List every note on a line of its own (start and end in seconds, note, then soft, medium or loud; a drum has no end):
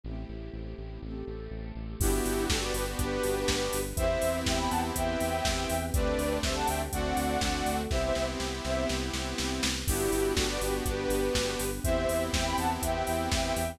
0.03 0.25 A1 medium
0.03 1.01 A3 medium
0.03 1.01 C4 medium
0.03 1.01 E4 medium
0.03 1.01 G4 medium
0.29 0.50 A1 medium
0.53 0.74 A1 medium
0.78 0.99 A1 medium
1.02 1.23 A1 medium
1.02 2.00 A3 medium
1.02 2.00 C4 medium
1.02 2.00 G4 medium
1.02 2.00 A4 medium
1.27 1.48 A1 medium
1.51 1.72 A1 medium
1.75 1.96 A1 medium
2.00 2.21 G1 loud
2.00 2.98 B3 medium
2.00 3.78 B3 medium
2.00 2.98 D4 loud
2.00 3.78 D4 medium
2.00 2.45 E4 medium
2.00 2.98 F#4 loud
2.00 3.78 F#4 medium
2.00 2.98 G4 medium
2.00 2.45 G4 medium
2.00 3.78 G4 medium
2.00 kick loud
2.00 crash loud
2.25 2.47 G1 medium
2.25 open hi-hat medium
2.49 2.72 G1 medium
2.49 2.61 F#4 medium
2.49 2.61 A4 medium
2.49 kick medium
2.49 snare loud
2.62 2.74 B4 medium
2.62 2.74 D5 medium
2.74 2.95 G1 medium
2.74 2.86 G4 medium
2.74 2.86 B4 medium
2.74 open hi-hat medium
2.98 3.19 G1 loud
2.98 3.97 B3 loud
2.98 3.97 D4 medium
2.98 3.81 G4 medium
2.98 3.97 G4 medium
2.98 3.81 B4 medium
2.98 3.97 B4 medium
2.98 kick medium
2.98 closed hi-hat medium
3.23 3.45 G1 medium
3.23 open hi-hat medium
3.48 3.69 G1 medium
3.48 kick medium
3.48 snare loud
3.73 3.94 G1 loud
3.73 open hi-hat medium
3.96 4.18 E2 loud
3.96 5.75 B3 medium
3.96 4.95 B3 loud
3.96 5.75 C4 medium
3.96 4.95 C4 medium
3.96 5.75 E4 medium
3.96 4.96 E4 loud
3.96 5.75 G4 medium
3.96 4.95 G4 medium
3.96 4.37 C5 medium
3.96 4.37 E5 medium
3.96 kick loud
3.96 closed hi-hat loud
4.22 4.44 E2 medium
4.22 open hi-hat medium
4.46 4.68 E2 loud
4.46 4.58 E5 medium
4.46 4.58 G5 medium
4.46 kick medium
4.46 snare loud
4.59 4.70 G5 medium
4.59 4.70 B5 medium
4.70 4.92 E2 medium
4.70 4.81 F#5 medium
4.70 4.81 A5 medium
4.70 open hi-hat medium
4.95 5.16 E2 medium
4.95 5.93 B3 medium
4.95 5.93 C4 medium
4.95 5.93 G4 medium
4.95 5.93 B4 loud
4.95 5.83 E5 medium
4.95 5.83 G5 medium
4.95 kick medium
4.95 closed hi-hat loud
5.20 5.41 E2 medium
5.20 open hi-hat medium
5.45 5.66 E2 medium
5.45 kick medium
5.45 snare loud
5.70 5.91 E2 loud
5.70 open hi-hat medium
5.94 6.15 D2 loud
5.94 6.82 A3 medium
5.94 6.42 A3 loud
5.94 6.82 C4 medium
5.94 6.42 C4 medium
5.94 6.82 D4 medium
5.94 6.43 D4 medium
5.94 6.82 G4 medium
5.94 6.42 G4 medium
5.94 6.37 B4 medium
5.94 6.37 D5 medium
5.94 kick loud
5.94 closed hi-hat loud
6.18 6.39 D2 medium
6.18 open hi-hat medium
6.43 6.64 D2 medium
6.43 6.92 G3 medium
6.43 6.92 A3 medium
6.43 6.92 C4 loud
6.43 6.92 G4 medium
6.43 6.55 C5 medium
6.43 6.55 E5 medium
6.43 kick medium
6.43 snare loud
6.56 6.68 F#5 medium
6.56 6.68 A5 medium
6.67 6.89 D2 loud
6.67 6.79 E5 medium
6.67 6.79 G5 medium
6.67 open hi-hat medium
6.92 7.13 D2 loud
6.92 7.41 A3 medium
6.92 7.81 A3 medium
6.92 7.41 C4 medium
6.92 7.81 C4 medium
6.92 7.41 D4 loud
6.92 7.81 D4 medium
6.92 7.41 F#4 medium
6.92 7.81 F#4 medium
6.92 7.76 D5 medium
6.92 7.76 F#5 medium
6.92 kick medium
6.92 closed hi-hat loud
7.17 7.37 D2 medium
7.17 open hi-hat medium
7.41 7.62 D2 medium
7.41 7.90 A3 medium
7.41 7.89 C4 medium
7.41 7.90 F#4 medium
7.41 7.90 A4 loud
7.41 kick medium
7.41 snare loud
7.66 7.87 D2 medium
7.66 open hi-hat medium
7.90 8.12 C2 loud
7.90 8.87 B3 medium
7.90 9.68 B3 medium
7.90 8.87 C4 loud
7.90 9.68 C4 medium
7.90 8.87 E4 loud
7.90 9.68 E4 medium
7.90 8.87 G4 loud
7.90 9.68 G4 medium
7.90 8.02 C5 medium
7.90 8.02 E5 medium
7.90 kick medium
7.90 snare medium
8.04 8.26 C5 medium
8.04 8.26 E5 medium
8.15 8.36 C2 medium
8.15 snare medium
8.40 8.61 C2 medium
8.40 snare medium
8.65 8.86 C2 loud
8.65 8.85 C5 medium
8.65 8.85 E5 medium
8.65 snare medium
8.89 9.10 C2 loud
8.89 9.87 B3 medium
8.89 9.87 C4 medium
8.89 9.87 G4 loud
8.89 9.87 B4 medium
8.89 snare medium
9.13 9.34 C2 medium
9.13 snare medium
9.38 9.60 C2 medium
9.38 snare medium
9.63 9.84 C2 medium
9.63 snare loud
9.87 10.09 G1 loud
9.87 11.64 B3 medium
9.87 10.85 B3 medium
9.87 11.64 D4 medium
9.87 10.85 D4 loud
9.87 10.32 E4 medium
9.87 11.64 F#4 medium
9.87 10.86 F#4 loud
9.87 11.64 G4 medium
9.87 10.32 G4 medium
9.87 10.85 G4 medium
9.87 kick loud
9.87 crash loud
10.12 10.33 G1 medium
10.12 open hi-hat medium
10.36 10.58 G1 medium
10.36 10.47 F#4 medium
10.36 10.47 A4 medium
10.36 kick medium
10.36 snare loud
10.49 10.60 B4 medium
10.49 10.60 D5 medium
10.61 10.82 G1 medium
10.61 10.74 G4 medium
10.61 10.74 B4 medium
10.61 open hi-hat medium
10.85 11.06 G1 loud
10.85 11.83 B3 loud
10.85 11.83 D4 medium
10.85 11.83 G4 medium
10.85 11.69 G4 medium
10.85 11.83 B4 medium
10.85 11.69 B4 medium
10.85 kick medium
10.85 closed hi-hat medium
11.09 11.30 G1 medium
11.09 open hi-hat medium
11.35 11.56 G1 medium
11.35 kick medium
11.35 snare loud
11.59 11.80 G1 loud
11.59 open hi-hat medium
11.84 12.06 E2 loud
11.84 12.81 B3 loud
11.84 13.61 B3 medium
11.84 12.81 C4 medium
11.84 13.61 C4 medium
11.84 12.81 E4 loud
11.84 13.61 E4 medium
11.84 12.81 G4 medium
11.84 13.61 G4 medium
11.84 12.24 C5 medium
11.84 12.24 E5 medium
11.84 kick loud
11.84 closed hi-hat loud
12.09 12.30 E2 medium
12.09 open hi-hat medium
12.33 12.55 E2 loud
12.33 12.46 E5 medium
12.33 12.45 G5 medium
12.33 kick medium
12.33 snare loud
12.46 12.57 G5 medium
12.46 12.57 B5 medium
12.57 12.78 E2 medium
12.57 12.70 F#5 medium
12.57 12.70 A5 medium
12.57 open hi-hat medium
12.81 13.03 E2 medium
12.81 13.79 B3 medium
12.81 13.79 C4 medium
12.81 13.79 G4 medium
12.81 13.79 B4 loud
12.81 13.69 E5 medium
12.81 13.69 G5 medium
12.81 kick medium
12.81 closed hi-hat loud
13.07 13.29 E2 medium
13.07 open hi-hat medium
13.32 13.53 E2 medium
13.32 kick medium
13.32 snare loud
13.56 13.77 E2 loud
13.56 open hi-hat medium